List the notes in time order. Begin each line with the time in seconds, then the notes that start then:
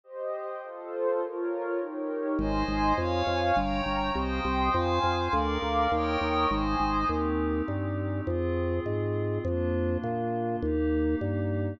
0.04 G4 C5 D#5
0.62 F4 A4 C5
1.21 F4 A#4 C#5
1.80 D#4 G4 A#4 C#5
2.39 G#1 C5 D#5 G#5 C6
2.68 G#1
2.97 F2 C#5 F5 G#5 C#6
3.27 F2
3.56 G1 C#5 G5 A#5 C#6
3.86 G1
4.15 C2 C5 D#5 G5 C6 D#6
4.45 C2
4.74 F2 C5 F5 G#5 C6
5.04 F2
5.33 D2 A#4 D5 F5 A#5 D6
5.62 D2
5.92 D#2 A#4 C#5 D#5 G5 A#5 C#6 D#6
6.21 D#2
6.50 G#1 C5 D#5 G#5 C6 D#6
6.80 G#1
7.09 D#2 C4 D#4 G4
7.68 G2
8.27 F2 C4 F4 G#4
8.86 G#2
9.45 F2 A#3 D4 F4
10.04 A#2
10.62 D#2 A#3 D#4 G4
11.21 G2